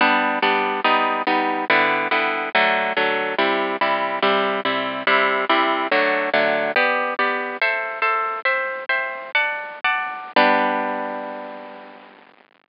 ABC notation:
X:1
M:4/4
L:1/8
Q:1/4=142
K:G
V:1 name="Orchestral Harp"
[G,B,D]2 [G,B,D]2 [G,B,^D]2 [G,B,D]2 | [D,G,B,E]2 [D,G,B,E]2 [D,F,A,]2 [D,F,A,]2 | [C,G,E]2 [C,G,E]2 [C,G,E]2 [C,G,E]2 | [C,G,E]2 [C,G,E]2 [D,F,A,]2 [D,F,A,]2 |
[B,Gd]2 [B,Gd]2 [Ace]2 [Ace]2 | "^rit." [ceg]2 [ceg]2 [dfa]2 [dfa]2 | [G,B,D]8 |]